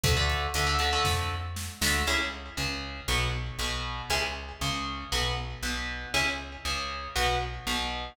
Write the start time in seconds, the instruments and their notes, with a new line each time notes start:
0.03 electric bass (finger) D2, overdriven guitar D3 A3, kick, closed hi-hat
0.17 overdriven guitar D3 A3
0.30 closed hi-hat
0.54 electric bass (finger) D2, overdriven guitar D3 A3, closed hi-hat
0.67 overdriven guitar D3 A3
0.79 overdriven guitar D3 A3, closed hi-hat
0.93 overdriven guitar D3 A3
1.05 electric bass (finger) F2, kick, snare
1.56 snare
1.81 electric bass (finger) D2, overdriven guitar D3 A3, snare
2.07 electric bass (finger) C#2, overdriven guitar C#4 E4 G#4
2.57 electric bass (finger) C#2, overdriven guitar C#3
3.08 electric bass (finger) B1, overdriven guitar B3 F#4
3.59 electric bass (finger) B1, overdriven guitar B2
4.10 electric bass (finger) C#2, overdriven guitar C#4 E4 G#4
4.61 electric bass (finger) C#2, overdriven guitar C#3
5.12 electric bass (finger) B1, overdriven guitar B3 F#4
5.63 electric bass (finger) B1, overdriven guitar B2
6.14 electric bass (finger) C#2, overdriven guitar C#4 E4 G#4
6.65 electric bass (finger) C#2, overdriven guitar C#3
7.16 electric bass (finger) B1, overdriven guitar B3 F#4
7.67 electric bass (finger) B1, overdriven guitar B2